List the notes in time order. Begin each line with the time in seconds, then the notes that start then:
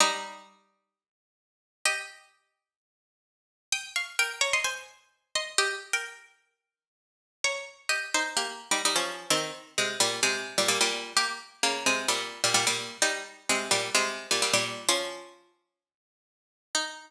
0.00 G3 D#4
1.85 G4 D#5
3.72 G5 D#6
3.96 F5 C#6
4.19 A#4 G5
4.41 C#5 A#5
4.53 D#5 C6
4.64 C5 G#5
5.35 D#5 C6
5.58 G4 D#5
5.93 A#4 G5
7.44 C#5 A#5
7.89 G4 D#5
8.14 D#4 C5
8.37 A#3 G4
8.71 G3 D#4
8.85 G3 D#4
8.96 F3 C#4
9.30 D#3 C4
9.78 C3 G#3
10.00 A#2 G3
10.23 C3 G#3
10.58 A#2 G3
10.68 A#2 G3
10.81 A#2 G3
11.17 A#3 G4
11.63 C#3 A#3
11.86 C3 G#3
12.08 A#2 G3
12.44 A#2 G3
12.54 A#2 G3
12.67 A#2 G3
13.02 G3 D#4
13.49 C3 G#3
13.71 A#2 G3
13.95 C3 G#3
14.31 A#2 G3
14.42 A#2 G3
14.53 A#2 G3
14.89 F3 C#4
16.75 D#4